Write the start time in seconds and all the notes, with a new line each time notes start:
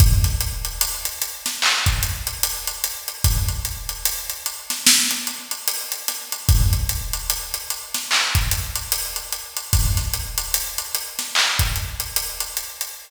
0.00 kick, closed hi-hat
0.24 snare, closed hi-hat
0.41 closed hi-hat
0.65 closed hi-hat
0.81 closed hi-hat
1.05 closed hi-hat
1.22 closed hi-hat
1.46 snare, closed hi-hat
1.62 clap
1.86 kick, closed hi-hat
2.03 closed hi-hat
2.27 closed hi-hat
2.43 closed hi-hat
2.67 closed hi-hat
2.84 closed hi-hat
3.08 closed hi-hat
3.24 kick, closed hi-hat
3.48 closed hi-hat
3.65 closed hi-hat
3.89 closed hi-hat
4.05 closed hi-hat
4.30 closed hi-hat
4.46 closed hi-hat
4.70 snare, closed hi-hat
4.86 snare
5.11 closed hi-hat
5.27 closed hi-hat
5.51 closed hi-hat
5.68 closed hi-hat
5.92 closed hi-hat
6.08 snare, closed hi-hat
6.32 closed hi-hat
6.49 kick, closed hi-hat
6.73 closed hi-hat
6.89 closed hi-hat
7.13 closed hi-hat
7.30 closed hi-hat
7.54 closed hi-hat
7.70 closed hi-hat
7.94 snare, closed hi-hat
8.11 clap
8.35 kick, closed hi-hat
8.51 closed hi-hat
8.76 closed hi-hat
8.92 closed hi-hat
9.16 closed hi-hat
9.32 closed hi-hat
9.57 closed hi-hat
9.73 kick, closed hi-hat
9.97 snare, closed hi-hat
10.14 closed hi-hat
10.38 closed hi-hat
10.54 closed hi-hat
10.78 closed hi-hat
10.95 closed hi-hat
11.19 snare, closed hi-hat
11.35 clap
11.59 kick, closed hi-hat
11.76 closed hi-hat
12.00 closed hi-hat
12.16 closed hi-hat
12.40 closed hi-hat
12.57 closed hi-hat
12.81 closed hi-hat